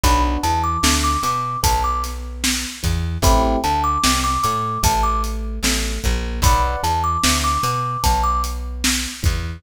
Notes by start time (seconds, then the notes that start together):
0.04 B1 B3 D4 F#4 B5, kick, closed hi-hat
0.43 E2 E3 A5, closed hi-hat
0.64 D6
0.83 D2 D3, snare
1.04 D6
1.23 B2 B3 D6, closed hi-hat
1.63 B1 B3 A5, kick, closed hi-hat
1.84 D6
2.04 snare, closed hi-hat
2.44 snare
2.83 E2 E3, kick, closed hi-hat
3.22 A1 A3 C4 E4 G4 B5, kick, closed hi-hat
3.64 D2 D3 A5, closed hi-hat
3.84 D6
4.04 C2 C3, snare
4.24 D6
4.43 A2 A3 D6, closed hi-hat
4.83 A1 A3 A5, kick, closed hi-hat
5.03 D6
5.24 closed hi-hat
5.63 A1 A3, snare
6.04 A#1 A#3, kick, closed hi-hat
6.42 B1 B4 D5 F#5 B5, kick, closed hi-hat
6.83 E2 E3 A5, closed hi-hat
7.04 D6
7.24 D2 D3, snare
7.44 D6
7.63 B2 B3 D6, closed hi-hat
8.04 B1 B3 A5, kick, closed hi-hat
8.24 D6
8.44 closed hi-hat
8.84 snare
9.23 E2 E3, kick, closed hi-hat